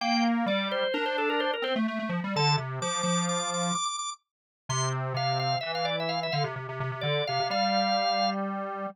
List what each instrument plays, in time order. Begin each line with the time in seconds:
0.01 lead 1 (square) A#3, drawbar organ G5
0.46 lead 1 (square) G3, drawbar organ D5
0.71 drawbar organ C5
0.94 lead 1 (square) D4, drawbar organ A#4
1.06 drawbar organ C5
1.18 drawbar organ A4
1.30 drawbar organ A#4
1.40 drawbar organ C5
1.54 drawbar organ A#4
1.62 lead 1 (square) C4, drawbar organ C5
1.76 lead 1 (square) A3
1.88 lead 1 (square) A3
1.99 lead 1 (square) A3
2.09 lead 1 (square) F3
2.24 lead 1 (square) G3
2.36 lead 1 (square) D3, drawbar organ A5
2.57 lead 1 (square) C3
2.82 lead 1 (square) F3, drawbar organ D6
3.03 lead 1 (square) F3, drawbar organ D6
3.29 drawbar organ D6
3.39 drawbar organ D6
3.54 drawbar organ D6
3.63 drawbar organ D6
3.75 drawbar organ D6
3.85 drawbar organ D6
3.99 drawbar organ D6
4.69 lead 1 (square) C3, drawbar organ C6
5.14 lead 1 (square) C3, drawbar organ F5
5.39 drawbar organ F5
5.61 lead 1 (square) E3, drawbar organ E5
5.75 drawbar organ F5
5.85 drawbar organ D5
6.00 drawbar organ E5
6.09 drawbar organ F5
6.23 drawbar organ E5
6.32 lead 1 (square) D3, drawbar organ F5
6.44 lead 1 (square) C3
6.56 lead 1 (square) C3
6.69 lead 1 (square) C3
6.80 lead 1 (square) C3
6.92 lead 1 (square) C3
7.01 lead 1 (square) D3, drawbar organ D5
7.27 lead 1 (square) C3, drawbar organ F5
7.40 lead 1 (square) C3
7.50 lead 1 (square) G3, drawbar organ F5